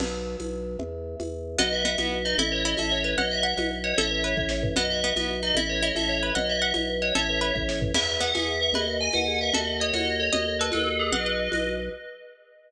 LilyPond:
<<
  \new Staff \with { instrumentName = "Tubular Bells" } { \time 6/8 \key b \mixolydian \tempo 4. = 151 r2. | r2. | dis''8 e''8 e''8 r4 dis''8 | e''8 cis''8 dis''8 e''8 cis''4 |
dis''8 e''8 e''8 r4 cis''8 | <cis'' e''>4. r4. | dis''8 e''8 e''8 r4 dis''8 | e''8 cis''8 dis''8 e''8 cis''4 |
dis''8 e''8 e''8 r4 cis''8 | <cis'' e''>4. r4. | e''8 r8 fis''8 e''4 e''8 | dis''8 r8 gis''8 fis''4 e''8 |
dis''8 r8 cis''8 dis''4 cis''8 | dis''8 r8 b'8 a'4 gis'8 | <b' dis''>2 r4 | }
  \new Staff \with { instrumentName = "Pizzicato Strings" } { \time 6/8 \key b \mixolydian r2. | r2. | b4 b8 b4 dis'8 | e'4 e'8 a'4 b'8 |
fis''4 fis''8 fis''4 fis''8 | a'4 b'4 r4 | b4 b8 b4 dis'8 | e'4 e'8 a'4 b'8 |
fis''4 fis''8 fis''4 fis''8 | a'4 b'4 r4 | e'4 b8 gis'4. | b'4 r2 |
a'4 dis''8 fis'4. | dis''4 a'8 fis''4. | fis''8 fis''4 r4. | }
  \new Staff \with { instrumentName = "Vibraphone" } { \time 6/8 \key b \mixolydian r2. | r2. | fis'8 b'8 dis''8 b'8 fis'8 b'8 | a'8 b'8 cis''8 e''8 cis''8 b'8 |
b'8 dis''8 fis''8 dis''8 b'8 dis''8 | a'8 b'8 cis''8 e''8 cis''8 b'8 | fis'8 b'8 dis''8 b'8 fis'8 b'8 | a'8 b'8 cis''8 e''8 cis''8 b'8 |
b'8 dis''8 fis''8 dis''8 b'8 dis''8 | a'8 b'8 cis''8 e''8 cis''8 b'8 | gis'8 b'8 e''8 b'8 gis'8 b'8 | gis'8 b'8 dis''8 b'8 gis'8 b'8 |
fis'8 a'8 dis''8 a'8 fis'8 a'8 | fis'8 a'8 dis''8 a'8 fis'8 a'8 | fis'8 b'8 dis''8 b'8 fis'8 b'8 | }
  \new Staff \with { instrumentName = "Drawbar Organ" } { \clef bass \time 6/8 \key b \mixolydian b,,4. b,,4. | e,4. e,4. | b,,4. b,,4. | a,,4. a,,4. |
b,,4. b,,4. | a,,4. a,,4. | b,,4. b,,4. | a,,4. a,,4. |
b,,4. b,,4. | a,,4. a,,4. | e,4. e,4. | dis,4. dis,4. |
dis,4. dis,4. | dis,4. dis,4. | b,,4. b,,4. | }
  \new DrumStaff \with { instrumentName = "Drums" } \drummode { \time 6/8 <cgl cymc>4. <cgho tamb>4. | cgl4. <cgho tamb>4. | cgl4. <cgho tamb>4. | cgl4. <cgho tamb>4. |
cgl4. <cgho tamb>4. | cgl4. bd8 sn8 tomfh8 | cgl4. <cgho tamb>4. | cgl4. <cgho tamb>4. |
cgl4. <cgho tamb>4. | cgl4. bd8 sn8 tomfh8 | <cgl cymc>4. <cgho tamb>4. | cgl4. <cgho tamb>4. |
cgl4. <cgho tamb>4. | cgl4. <cgho tamb>4. | cgl4. <cgho tamb>4. | }
>>